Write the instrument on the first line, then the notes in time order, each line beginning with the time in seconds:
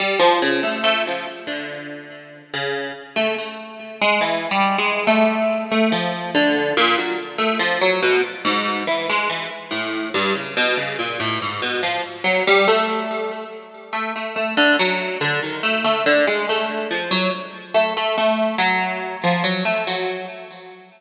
orchestral harp
0.00 G3
0.20 F3
0.42 C#3
0.63 A3
0.84 A3
1.07 F3
1.47 D3
2.54 C#3
3.16 A3
3.38 A3
4.02 G#3
4.21 E3
4.51 G3
4.78 G#3
5.07 A3
5.72 A3
5.92 F3
6.35 D3
6.77 A#2
6.98 F#3
7.38 A3
7.60 F3
7.82 F#3
8.03 B2
8.45 G#2
8.87 E3
9.10 G#3
9.29 E3
9.71 A2
10.14 G2
10.35 C#3
10.57 B2
10.77 C#3
10.99 A#2
11.20 A2
11.42 G#2
11.62 B2
11.83 F3
12.24 F#3
12.47 G3
12.68 A3
13.93 A3
14.16 A3
14.36 A3
14.57 D3
14.79 F#3
15.21 D3
15.42 D#3
15.63 A3
15.84 A3
16.06 D3
16.27 G#3
16.49 A3
16.91 F3
17.11 F#3
17.74 A3
17.97 A3
18.18 A3
18.58 F#3
19.24 F3
19.44 F#3
19.65 A3
19.87 F#3